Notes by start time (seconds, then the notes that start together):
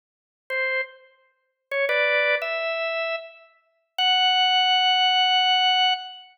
0.50 C5
1.71 C#5
1.89 B4 D5
2.42 E5
3.98 F#5